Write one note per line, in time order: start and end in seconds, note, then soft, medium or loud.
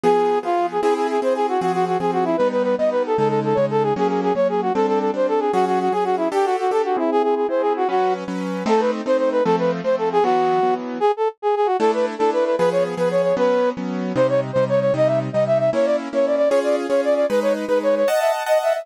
0.03 0.39 F3 loud
0.03 0.39 B3 loud
0.03 0.39 G#4 loud
0.03 0.39 G#4 medium
0.43 0.78 F3 medium
0.43 0.78 B3 medium
0.43 0.66 F4 medium
0.43 0.78 G#4 medium
0.72 0.81 G#4 medium
0.81 1.18 C4 loud
0.81 1.18 E4 loud
0.81 0.94 G#4 medium
0.81 1.18 G#4 loud
0.96 1.07 G#4 medium
1.10 1.20 G#4 medium
1.22 1.57 C4 medium
1.22 1.57 E4 medium
1.22 1.57 G#4 loud
1.22 1.34 C5 medium
1.35 1.47 G#4 medium
1.49 1.61 F#4 medium
1.61 1.97 F3 medium
1.61 1.97 C4 loud
1.61 1.72 F#4 medium
1.61 1.97 G#4 loud
1.74 1.85 F#4 medium
1.87 1.98 F#4 medium
2.00 2.35 F3 medium
2.00 2.35 C4 medium
2.00 2.35 G#4 medium
2.00 2.11 G#4 medium
2.13 2.24 F#4 medium
2.25 2.37 E4 medium
2.37 2.75 G3 medium
2.37 2.75 B3 medium
2.37 2.75 D#4 medium
2.37 2.48 B4 medium
2.51 2.63 B4 medium
2.63 2.75 B4 medium
2.78 3.14 G3 medium
2.78 3.14 B3 medium
2.78 3.14 D#4 medium
2.78 2.90 D#5 medium
2.91 3.03 B4 medium
3.06 3.17 A4 medium
3.18 3.53 C#3 medium
3.18 3.53 G#3 loud
3.18 3.53 D#4 medium
3.18 3.28 A4 medium
3.29 3.40 A4 medium
3.44 3.57 A4 medium
3.55 3.93 C#3 medium
3.55 3.93 G#3 medium
3.55 3.93 D#4 medium
3.55 3.66 C#5 medium
3.71 3.83 A4 medium
3.83 3.94 G#4 medium
3.96 4.32 F#3 loud
3.96 4.32 A#3 loud
3.96 4.32 C#4 loud
3.96 4.08 G#4 medium
4.08 4.21 G#4 medium
4.23 4.33 G#4 medium
4.35 4.70 F#3 medium
4.35 4.70 A#3 medium
4.35 4.70 C#4 medium
4.35 4.48 C#5 medium
4.49 4.61 G#4 medium
4.62 4.73 F#4 medium
4.74 5.10 G3 medium
4.74 5.10 C4 loud
4.74 5.10 D4 medium
4.74 4.86 A4 medium
4.87 4.99 A4 medium
5.00 5.11 A4 medium
5.14 5.49 G3 medium
5.14 5.49 C4 medium
5.14 5.49 D4 medium
5.14 5.27 C5 medium
5.28 5.40 A4 medium
5.40 5.52 G#4 medium
5.53 5.89 F#3 medium
5.53 5.89 C#4 loud
5.53 5.65 F#4 medium
5.53 5.89 G#4 loud
5.67 5.79 F#4 medium
5.80 5.92 F#4 medium
5.92 6.28 F#3 medium
5.92 6.28 C#4 medium
5.92 6.04 G#4 medium
5.92 6.28 G#4 medium
6.04 6.16 F#4 medium
6.17 6.28 E4 medium
6.32 6.67 D4 loud
6.32 6.67 G4 loud
6.32 6.46 G4 medium
6.32 6.67 A4 loud
6.45 6.56 F#4 medium
6.59 6.71 F#4 medium
6.71 6.96 D4 medium
6.71 6.96 G4 medium
6.71 6.96 A4 medium
6.71 6.82 A4 medium
6.85 6.96 F#4 medium
6.97 7.45 C4 medium
6.97 7.45 E4 loud
6.97 7.10 E4 medium
6.97 7.45 G#4 loud
7.12 7.22 G#4 medium
7.23 7.35 G#4 medium
7.36 7.47 G#4 medium
7.49 7.84 C4 medium
7.49 7.84 E4 medium
7.49 7.84 G#4 medium
7.49 7.62 C5 medium
7.61 7.73 G#4 medium
7.76 7.88 F#4 medium
7.89 8.24 F#3 medium
7.89 8.24 C#4 loud
7.89 8.14 F#4 medium
7.89 8.24 B4 medium
8.28 8.63 F#3 medium
8.28 8.63 C#4 medium
8.28 8.63 B4 medium
8.66 9.01 A3 loud
8.66 9.01 C4 loud
8.66 9.01 D#4 loud
8.66 8.81 A4 medium
8.80 8.91 B4 medium
9.06 9.41 A3 medium
9.06 9.41 C4 medium
9.06 9.41 D#4 loud
9.06 9.17 C5 medium
9.18 9.30 C5 medium
9.32 9.44 B4 medium
9.45 9.81 F3 loud
9.45 9.81 A3 loud
9.45 9.81 C4 loud
9.45 9.56 A4 medium
9.59 9.71 B4 medium
9.84 10.20 F3 medium
9.84 10.20 A3 loud
9.84 10.20 C4 loud
9.84 9.96 C5 medium
9.98 10.09 A4 medium
10.12 10.24 G#4 medium
10.23 10.59 E3 loud
10.23 10.59 F#3 loud
10.23 10.59 B3 loud
10.23 10.74 F#4 medium
10.63 10.98 E3 loud
10.63 10.98 F#3 medium
10.63 10.98 B3 loud
11.00 11.12 G#4 medium
11.17 11.28 A4 medium
11.42 11.55 G#4 medium
11.56 11.67 G#4 medium
11.66 11.77 F#4 medium
11.79 12.15 A3 loud
11.79 12.15 D4 loud
11.79 12.15 E4 loud
11.79 11.91 A4 medium
11.94 12.06 B4 medium
12.18 12.55 A3 loud
12.18 12.55 D4 loud
12.18 12.55 E4 medium
12.18 12.30 A4 medium
12.33 12.44 B4 medium
12.45 12.56 B4 medium
12.58 12.94 F3 loud
12.58 12.94 B3 loud
12.58 12.94 G#4 loud
12.58 12.69 B4 medium
12.72 12.83 C#5 medium
12.97 13.33 F3 medium
12.97 13.33 B3 loud
12.97 13.33 G#4 loud
12.97 13.09 B4 medium
13.11 13.22 C#5 medium
13.23 13.35 C#5 medium
13.37 13.72 F#3 loud
13.37 13.72 B3 loud
13.37 13.72 C#4 loud
13.37 13.70 B4 medium
13.77 14.12 F#3 medium
13.77 14.12 B3 medium
13.77 14.12 C#4 medium
14.16 14.51 C3 loud
14.16 14.51 G3 loud
14.16 14.51 D#4 loud
14.16 14.27 C5 medium
14.29 14.40 C#5 medium
14.53 14.91 C3 medium
14.53 14.91 G3 loud
14.53 14.91 D#4 medium
14.53 14.64 C5 medium
14.69 14.80 C#5 medium
14.80 14.93 C#5 medium
14.94 15.29 C3 loud
14.94 15.29 G3 loud
14.94 15.29 D#4 loud
14.94 15.08 D#5 medium
15.07 15.19 E5 medium
15.33 15.69 C3 medium
15.33 15.69 G3 medium
15.33 15.69 D#4 loud
15.33 15.44 D#5 medium
15.47 15.58 E5 medium
15.59 15.70 E5 medium
15.73 16.08 A#3 loud
15.73 16.08 C#4 loud
15.73 16.08 E4 loud
15.73 15.86 C#5 medium
15.85 15.96 D5 medium
16.13 16.48 A#3 medium
16.13 16.48 C#4 medium
16.13 16.48 E4 medium
16.13 16.26 C#5 medium
16.26 16.36 D5 medium
16.36 16.49 D5 medium
16.49 16.86 C#4 loud
16.49 16.86 F4 loud
16.49 16.86 G#4 loud
16.49 16.60 C#5 medium
16.64 16.76 D5 medium
16.89 17.25 C#4 loud
16.89 17.25 F4 medium
16.89 17.25 G#4 loud
16.89 17.01 C#5 medium
17.04 17.14 D5 medium
17.15 17.26 D5 medium
17.29 17.65 G#3 loud
17.29 17.65 D#4 loud
17.29 17.40 B4 medium
17.29 17.65 B4 loud
17.42 17.53 C#5 medium
17.68 18.04 G#3 loud
17.68 18.04 D#4 medium
17.68 17.79 B4 medium
17.68 18.04 B4 medium
17.83 17.95 C#5 medium
17.96 18.08 C#5 medium
18.08 18.20 D#5 medium
18.08 18.43 D#5 loud
18.08 18.43 F#5 loud
18.08 18.43 A5 loud
18.20 18.32 E5 medium
18.46 18.82 D#5 loud
18.46 18.58 D#5 medium
18.46 18.82 F#5 loud
18.46 18.82 A5 medium
18.63 18.73 E5 medium
18.73 18.86 E5 medium